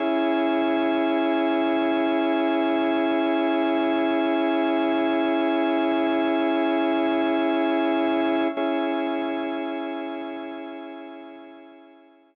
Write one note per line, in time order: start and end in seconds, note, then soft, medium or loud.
0.00 8.48 C#4 medium
0.00 8.48 E4 medium
0.00 8.48 G#4 medium
8.57 12.35 C#4 medium
8.57 12.35 E4 medium
8.57 12.35 G#4 medium